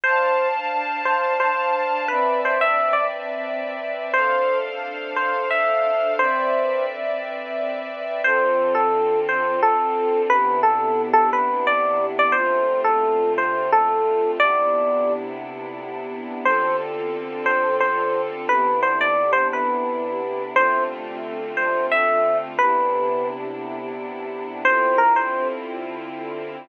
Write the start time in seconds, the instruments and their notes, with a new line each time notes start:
0.04 string ensemble 1 D4 C5 F5 A5, electric piano 1 C5
1.05 electric piano 1 C5
1.40 electric piano 1 C5
2.08 string ensemble 1 C4 B4 D5 E5, electric piano 1 B4
2.45 electric piano 1 C5
2.61 electric piano 1 E5
2.93 electric piano 1 D5
4.13 string ensemble 1 D4 A4 C5 F5, electric piano 1 C5
5.16 electric piano 1 C5
5.51 electric piano 1 E5
6.18 string ensemble 1 C4 B4 D5 E5, electric piano 1 C5
8.24 string ensemble 1 D3 C4 F4 A4, electric piano 1 C5
8.75 electric piano 1 A4
9.29 electric piano 1 C5
9.63 electric piano 1 A4
10.29 string ensemble 1 C3 B3 D4 E4, electric piano 1 B4
10.63 electric piano 1 A4
11.13 electric piano 1 A4
11.33 electric piano 1 B4
11.67 electric piano 1 D5
12.19 electric piano 1 D5
12.32 string ensemble 1 D3 A3 C4 F4, electric piano 1 C5
12.84 electric piano 1 A4
13.38 electric piano 1 C5
13.72 electric piano 1 A4
14.40 string ensemble 1 C3 B3 D4 E4, electric piano 1 D5
16.45 string ensemble 1 D3 C4 F4 A4, electric piano 1 C5
17.46 electric piano 1 C5
17.80 electric piano 1 C5
18.49 string ensemble 1 C3 B3 D4 E4, electric piano 1 B4
18.83 electric piano 1 C5
19.01 electric piano 1 D5
19.33 electric piano 1 C5
19.53 electric piano 1 B4
20.54 string ensemble 1 D3 A3 C4 F4, electric piano 1 C5
21.57 electric piano 1 C5
21.92 electric piano 1 E5
22.59 string ensemble 1 C3 B3 D4 E4, electric piano 1 B4
24.65 string ensemble 1 D3 C4 E4 F4, electric piano 1 C5
24.98 electric piano 1 A#4
25.16 electric piano 1 C5